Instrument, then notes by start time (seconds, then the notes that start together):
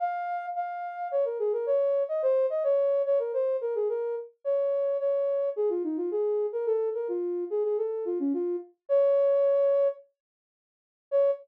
ocarina
0.00 F5
0.55 F5
1.11 C#5
1.25 A#4
1.39 G#4
1.53 A#4
1.66 C#5
2.09 D#5
2.22 C5
2.50 D#5
2.64 C#5
3.06 C#5
3.19 A#4
3.34 C5
3.61 A#4
3.75 G#4
3.89 A#4
4.44 C#5
5.00 C#5
5.56 G#4
5.69 F4
5.84 D#4
5.97 F4
6.11 G#4
6.53 A#4
6.66 A4
6.94 A#4
7.08 F4
7.50 G#4
7.64 G#4
7.78 A4
8.05 F4
8.20 C#4
8.34 F4
8.89 C#5
11.11 C#5